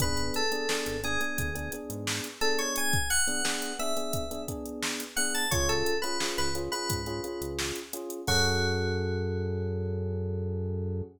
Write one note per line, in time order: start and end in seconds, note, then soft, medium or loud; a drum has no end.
0.00 0.31 G#1 medium
0.00 0.41 B3 loud
0.00 0.41 D4 loud
0.00 0.41 G#4 loud
0.00 0.33 B4 medium
0.00 kick loud
0.00 closed hi-hat loud
0.17 closed hi-hat medium
0.34 1.00 A4 medium
0.34 closed hi-hat loud
0.52 0.65 B3 medium
0.52 0.65 D4 medium
0.52 0.65 G#4 loud
0.52 closed hi-hat medium
0.69 0.96 B3 medium
0.69 0.96 D4 loud
0.69 0.96 G#4 medium
0.69 snare loud
0.86 1.17 G#1 medium
0.86 closed hi-hat medium
1.04 1.17 B3 medium
1.04 1.17 D4 medium
1.04 1.17 G#4 medium
1.04 1.71 G#4 medium
1.04 closed hi-hat medium
1.21 1.48 B3 medium
1.21 1.48 D4 medium
1.21 1.48 G#4 loud
1.21 closed hi-hat medium
1.38 1.69 D2 medium
1.38 kick loud
1.38 closed hi-hat loud
1.55 1.69 B3 medium
1.55 1.69 D4 medium
1.55 1.69 G#4 medium
1.55 closed hi-hat medium
1.72 2.28 B3 medium
1.72 2.28 D4 medium
1.72 2.28 G#4 medium
1.72 closed hi-hat loud
1.90 2.21 G#2 medium
1.90 closed hi-hat loud
2.07 snare loud
2.24 closed hi-hat medium
2.41 2.96 B3 medium
2.41 2.96 D4 medium
2.41 2.96 G#4 medium
2.41 2.58 A4 medium
2.41 closed hi-hat medium
2.58 2.75 C#5 medium
2.58 closed hi-hat medium
2.76 3.08 G#5 medium
2.76 closed hi-hat loud
2.93 kick loud
2.93 closed hi-hat medium
3.10 3.76 F#5 medium
3.10 closed hi-hat medium
3.27 3.41 B3 loud
3.27 3.41 D4 medium
3.27 3.41 G#4 medium
3.27 closed hi-hat medium
3.45 3.72 B3 medium
3.45 3.72 D4 medium
3.45 3.72 G#4 loud
3.45 snare loud
3.62 closed hi-hat medium
3.79 3.93 B3 medium
3.79 3.93 D4 medium
3.79 3.93 G#4 loud
3.79 4.41 E5 medium
3.79 closed hi-hat medium
3.97 4.24 B3 medium
3.97 4.24 D4 medium
3.97 4.24 G#4 medium
3.97 closed hi-hat medium
4.13 kick loud
4.13 closed hi-hat loud
4.31 4.45 B3 medium
4.31 4.45 D4 medium
4.31 4.45 G#4 medium
4.31 closed hi-hat medium
4.48 5.03 B3 loud
4.48 5.03 D4 medium
4.48 5.03 G#4 medium
4.48 kick medium
4.48 closed hi-hat loud
4.66 closed hi-hat medium
4.82 snare loud
5.00 closed hi-hat loud
5.16 5.45 B3 medium
5.16 5.45 D4 medium
5.16 5.45 G#4 medium
5.16 5.33 F#5 medium
5.16 closed hi-hat medium
5.34 5.51 A5 medium
5.34 closed hi-hat medium
5.51 5.83 C#2 medium
5.51 5.93 C#4 loud
5.51 5.93 F4 loud
5.51 5.93 G#4 medium
5.51 5.68 C#5 medium
5.51 kick loud
5.51 closed hi-hat loud
5.69 5.97 A4 medium
5.69 closed hi-hat medium
5.86 closed hi-hat loud
6.02 6.17 C#4 loud
6.02 6.17 F4 medium
6.02 6.17 G#4 medium
6.02 6.32 B4 medium
6.02 closed hi-hat medium
6.20 6.48 C#4 medium
6.20 6.48 F4 medium
6.20 6.48 G#4 medium
6.20 snare loud
6.38 6.69 C#2 medium
6.38 6.54 B4 medium
6.38 closed hi-hat medium
6.55 6.69 C#4 loud
6.55 6.69 F4 loud
6.55 6.69 G#4 medium
6.55 closed hi-hat loud
6.72 7.00 C#4 medium
6.72 7.00 F4 medium
6.72 7.00 G#4 medium
6.72 7.49 B4 medium
6.72 closed hi-hat medium
6.89 7.20 G#2 medium
6.89 kick loud
6.89 closed hi-hat loud
7.06 7.21 C#4 medium
7.06 7.21 F4 medium
7.06 7.21 G#4 loud
7.06 closed hi-hat medium
7.24 7.79 C#4 medium
7.24 7.79 F4 medium
7.24 7.79 G#4 medium
7.24 closed hi-hat medium
7.41 7.72 C#2 medium
7.41 closed hi-hat medium
7.59 snare loud
7.76 closed hi-hat medium
7.93 8.21 C#4 medium
7.93 8.21 F4 medium
7.93 8.21 G#4 medium
7.93 closed hi-hat loud
8.10 closed hi-hat loud
8.27 11.02 F#2 loud
8.27 11.02 C#4 loud
8.27 11.02 F#4 loud
8.27 11.02 G#4 loud
8.27 11.02 A4 loud
8.27 kick loud
8.27 crash loud